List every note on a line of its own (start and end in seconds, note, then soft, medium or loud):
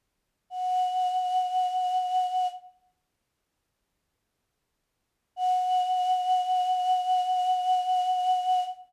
0.50 2.48 F#5 medium
5.36 8.64 F#5 loud